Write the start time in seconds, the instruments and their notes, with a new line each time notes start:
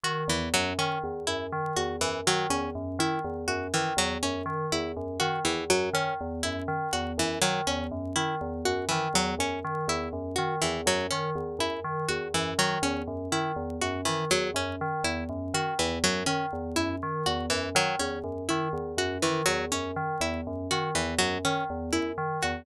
0.03 tubular bells D#3, harpsichord F#4
0.28 tubular bells E2, harpsichord E3
0.54 tubular bells F#2, harpsichord F#3
0.78 tubular bells D#3, harpsichord C#4
1.04 tubular bells E2
1.27 tubular bells F#2, harpsichord E4
1.52 tubular bells D#3
1.76 tubular bells E2, harpsichord F#4
2.01 tubular bells F#2, harpsichord E3
2.27 tubular bells D#3, harpsichord F#3
2.50 tubular bells E2, harpsichord C#4
2.75 tubular bells F#2
2.99 tubular bells D#3, harpsichord E4
3.24 tubular bells E2
3.48 tubular bells F#2, harpsichord F#4
3.74 tubular bells D#3, harpsichord E3
3.97 tubular bells E2, harpsichord F#3
4.23 tubular bells F#2, harpsichord C#4
4.46 tubular bells D#3
4.72 tubular bells E2, harpsichord E4
4.97 tubular bells F#2
5.20 tubular bells D#3, harpsichord F#4
5.45 tubular bells E2, harpsichord E3
5.70 tubular bells F#2, harpsichord F#3
5.93 tubular bells D#3, harpsichord C#4
6.21 tubular bells E2
6.43 tubular bells F#2, harpsichord E4
6.68 tubular bells D#3
6.93 tubular bells E2, harpsichord F#4
7.18 tubular bells F#2, harpsichord E3
7.41 tubular bells D#3, harpsichord F#3
7.67 tubular bells E2, harpsichord C#4
7.91 tubular bells F#2
8.16 tubular bells D#3, harpsichord E4
8.41 tubular bells E2
8.65 tubular bells F#2, harpsichord F#4
8.89 tubular bells D#3, harpsichord E3
9.14 tubular bells E2, harpsichord F#3
9.39 tubular bells F#2, harpsichord C#4
9.64 tubular bells D#3
9.88 tubular bells E2, harpsichord E4
10.13 tubular bells F#2
10.36 tubular bells D#3, harpsichord F#4
10.62 tubular bells E2, harpsichord E3
10.86 tubular bells F#2, harpsichord F#3
11.11 tubular bells D#3, harpsichord C#4
11.35 tubular bells E2
11.59 tubular bells F#2, harpsichord E4
11.84 tubular bells D#3
12.09 tubular bells E2, harpsichord F#4
12.34 tubular bells F#2, harpsichord E3
12.59 tubular bells D#3, harpsichord F#3
12.82 tubular bells E2, harpsichord C#4
13.08 tubular bells F#2
13.32 tubular bells D#3, harpsichord E4
13.56 tubular bells E2
13.81 tubular bells F#2, harpsichord F#4
14.05 tubular bells D#3, harpsichord E3
14.31 tubular bells E2, harpsichord F#3
14.54 tubular bells F#2, harpsichord C#4
14.81 tubular bells D#3
15.04 tubular bells E2, harpsichord E4
15.29 tubular bells F#2
15.54 tubular bells D#3, harpsichord F#4
15.79 tubular bells E2, harpsichord E3
16.04 tubular bells F#2, harpsichord F#3
16.26 tubular bells D#3, harpsichord C#4
16.53 tubular bells E2
16.76 tubular bells F#2, harpsichord E4
17.03 tubular bells D#3
17.26 tubular bells E2, harpsichord F#4
17.50 tubular bells F#2, harpsichord E3
17.75 tubular bells D#3, harpsichord F#3
17.99 tubular bells E2, harpsichord C#4
18.24 tubular bells F#2
18.49 tubular bells D#3, harpsichord E4
18.73 tubular bells E2
18.97 tubular bells F#2, harpsichord F#4
19.22 tubular bells D#3, harpsichord E3
19.46 tubular bells E2, harpsichord F#3
19.72 tubular bells F#2, harpsichord C#4
19.96 tubular bells D#3
20.20 tubular bells E2, harpsichord E4
20.47 tubular bells F#2
20.71 tubular bells D#3, harpsichord F#4
20.95 tubular bells E2, harpsichord E3
21.18 tubular bells F#2, harpsichord F#3
21.45 tubular bells D#3, harpsichord C#4
21.70 tubular bells E2
21.92 tubular bells F#2, harpsichord E4
22.18 tubular bells D#3
22.43 tubular bells E2, harpsichord F#4